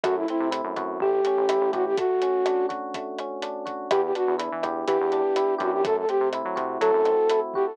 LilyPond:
<<
  \new Staff \with { instrumentName = "Flute" } { \time 4/4 \key e \minor \tempo 4 = 124 fis'16 e'16 e'8 r4 g'4. fis'16 g'16 | fis'4. r2 r8 | g'16 g'16 fis'8 r4 g'4. fis'16 g'16 | a'16 a'16 g'8 r4 a'4. g'16 a'16 | }
  \new Staff \with { instrumentName = "Electric Piano 1" } { \time 4/4 \key e \minor a8 c'8 e'8 fis'8 a8 cis'8 e'8 g'8 | a8 cis'8 d'8 fis'8 a8 cis'8 d'8 fis'8 | b8 d'8 e'8 g'8 b8 d'8 e'8 g'8 | a8 c'8 e'8 fis'8 a8 c'8 e'8 fis'8 | }
  \new Staff \with { instrumentName = "Synth Bass 1" } { \clef bass \time 4/4 \key e \minor fis,8. c8 fis,16 fis,8 a,,8. a,,8 a,,16 a,,8 | r1 | e,8. e,8 e16 e,8 e16 e,4~ e,16 fis,8~ | fis,8. c8 fis16 c8 fis16 fis,4.~ fis,16 | }
  \new DrumStaff \with { instrumentName = "Drums" } \drummode { \time 4/4 <hh bd ss>8 hh8 hh8 <hh bd ss>8 bd8 hh8 <hh ss>8 <hh bd>8 | <hh bd>8 hh8 <hh ss>8 <hh bd>8 <hh bd>8 <hh ss>8 hh8 <hh bd>8 | <hh bd ss>8 hh8 hh8 <hh bd ss>8 <hh bd>8 hh8 <hh ss>8 <hh bd>8 | <hh bd>8 hh8 <hh ss>8 <hh bd>8 <hh bd>8 <hh ss>8 hh8 bd8 | }
>>